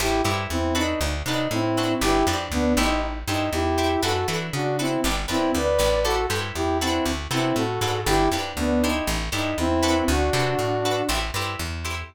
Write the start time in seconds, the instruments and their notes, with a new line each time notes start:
0.00 electric bass (finger) A1, lead 2 (sawtooth) E4 G4, acoustic guitar (steel) E4 G4 A4 C5
0.24 electric bass (finger) G2, acoustic guitar (steel) E4 G4 A4 C5
0.50 electric bass (finger) E2, lead 2 (sawtooth) C4 E4
0.75 acoustic guitar (steel) D4 F#4 A4 B4, lead 2 (sawtooth) D#4
1.01 electric bass (finger) D2
1.26 electric bass (finger) C3, acoustic guitar (steel) D4 F#4 A4 B4, lead 2 (sawtooth) D#4
1.51 electric bass (finger) A2, lead 2 (sawtooth) C4 E4
1.77 acoustic guitar (steel) D4 F#4 A4 B4
2.01 electric bass (finger) G1, acoustic guitar (steel) D4 G4 B4, lead 2 (sawtooth) E4 G4
2.27 electric bass (finger) F2, acoustic guitar (steel) D4 G4 B4
2.52 electric bass (finger) D2, lead 2 (sawtooth) B3 D4
2.77 electric bass (finger) A1, lead 2 (sawtooth) D#4, acoustic guitar (steel) E4 G4 A4 C5
3.27 electric bass (finger) G2, lead 2 (sawtooth) D#4, acoustic guitar (steel) E4 G4 A4 C5
3.53 electric bass (finger) E2, lead 2 (sawtooth) E4 G4
3.78 acoustic guitar (steel) E4 G4 A4 C5
4.03 electric bass (finger) F#2, acoustic guitar (steel) D4 F#4 A4 B4, lead 2 (sawtooth) F#4 A4
4.28 electric bass (finger) E3, acoustic guitar (steel) D4 F#4 A4 B4
4.53 electric bass (finger) C#3, lead 2 (sawtooth) D4 F#4
4.79 lead 2 (sawtooth) C4 E4, acoustic guitar (steel) D4 F#4 A4 B4
5.04 electric bass (finger) G1, acoustic guitar (steel) D4 G4 B4
5.28 electric bass (finger) F2, lead 2 (sawtooth) C4 E4, acoustic guitar (steel) D4 G4 B4
5.55 electric bass (finger) D2, lead 2 (sawtooth) B4 D5
5.79 electric bass (finger) A1, acoustic guitar (steel) D4 G4 B4
6.04 acoustic guitar (steel) E4 G4 A4 C5, lead 2 (sawtooth) F#4 A4
6.30 electric bass (finger) G2, acoustic guitar (steel) E4 G4 A4 C5
6.55 electric bass (finger) E2, lead 2 (sawtooth) E4 G4
6.81 lead 2 (sawtooth) C4 E4, acoustic guitar (steel) D4 F#4 A4 B4
7.06 electric bass (finger) D2
7.31 electric bass (finger) C3, lead 2 (sawtooth) C4 E4, acoustic guitar (steel) D4 F#4 A4 B4
7.56 electric bass (finger) A2, lead 2 (sawtooth) F#4 A4
7.81 electric bass (finger) G#2, acoustic guitar (steel) D4 F#4 A4 B4
8.06 electric bass (finger) G1, acoustic guitar (steel) D4 G4 B4, lead 2 (sawtooth) E4 G4
8.32 electric bass (finger) F2, acoustic guitar (steel) D4 G4 B4
8.57 electric bass (finger) D2, lead 2 (sawtooth) B3 D4
8.82 lead 2 (sawtooth) D#4, acoustic guitar (steel) E4 G4 A4 C5
9.07 electric bass (finger) A1
9.32 electric bass (finger) G2, lead 2 (sawtooth) D#4, acoustic guitar (steel) E4 G4 A4 C5
9.58 electric bass (finger) E2, lead 2 (sawtooth) C4 E4
9.83 acoustic guitar (steel) D4 F#4 A4 B4
10.08 electric bass (finger) D2, lead 2 (sawtooth) D4 F#4
10.33 electric bass (finger) C3, acoustic guitar (steel) D4 F#4 A4 B4
10.59 electric bass (finger) A2
10.85 acoustic guitar (steel) D4 F#4 A4 B4
11.09 electric bass (finger) A1, acoustic guitar (steel) E4 G4 A4 C5
11.34 electric bass (finger) G2, acoustic guitar (steel) E4 G4 A4 C5
11.59 electric bass (finger) E2
11.85 acoustic guitar (steel) E4 G4 A4 C5